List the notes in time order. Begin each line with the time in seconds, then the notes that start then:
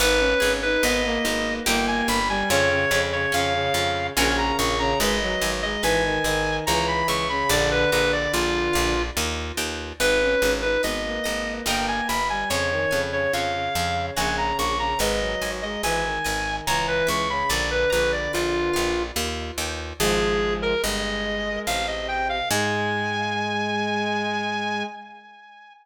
0.00 G#1 B3 D#4 B4
0.20 C#4
0.40 G#1 C#4 G#4
0.63 D#4 B4
0.83 G#1 B3 D#5
1.05 A#3
1.25 G#1 A#3 D#4
1.66 G1 A#3 D#4 G4 G5
1.87 G#5
2.08 G1 B5
2.29 G3 G#5
2.50 F2 C#3 C#4 C#5
2.70 C#3
2.91 F2 C#3 G#4
3.13 C#3 C#5
3.32 F2 C#3 C#4 F5
3.54 C#3
3.74 F2 C#3 F4
4.16 A#1 C#3 C#4 F#4 A#4 G#5
4.37 A#5
4.59 A#1 C#6
4.79 C#3 A#5
4.99 G#1 G#3 B4 D#5
5.22 F#3
5.41 G#1 F#3 G#5
5.63 G#3 D#5
5.83 G#1 E3 B4 G#5
6.05 D#3
6.24 G#1 D#3 D#5
6.67 C#2 E3 C#5 A#5
6.88 B5
7.08 C#2 E5 C#6
7.29 C#3 B5
7.49 A#1 D3 D5
7.71 B4
7.92 A#1 D3 B4 A#5
8.12 D5
8.33 A#1 F4 D5
8.73 A#1 F5
9.17 D#2 D#5
9.57 D#2 G5
9.99 G#1 D#4 B4
10.21 C#4
10.42 G#1 C#4 G#5
10.62 D#4 B4
10.83 G#1 B3 B4 D#5
11.05 A#3
11.24 G#1 A#3 D#5
11.66 G1 A#3 A#4 D#5 G5
11.88 G#5
12.08 G1 B5
12.29 G3 G#5
12.50 F2 C#3 C#5
12.71 D#3
12.91 F2 C#3 G#5
13.11 C#3 C#5
13.33 F2 C#3 C#5 F5
13.54 C#3
13.75 F2 C#3 F5
14.16 A#1 C#3 C#5 F#5 G#5 A#5
14.38 A#5
14.59 A#1 C#6
14.79 C#3 A#5
14.99 G#1 G#3 B4 D#5
15.20 F#3
15.41 G#1 F#3 G#5
15.62 G#3 D#5
15.83 G#1 E3 B4 G#5
16.05 D#3
16.24 G#1 D#3 D#5
16.67 C#2 E3 C#5 A#5
16.88 B4
17.07 C#2 E5 C#6
17.30 C#3 B5
17.49 A#1 D3 D5
17.71 B4
17.90 A#1 D3 B4 A#5
18.12 D5
18.33 A#1 F4 D5
18.73 A#1 F5
19.16 D#2 D#5
19.57 D#2 G5
20.00 G#1 F3 G#3 G#4
20.62 A#4
20.83 G1 G#3 D#5
21.67 A1 C3 F5
21.87 D#5
22.08 G5
22.29 F5
22.50 G#2 G#3 G#5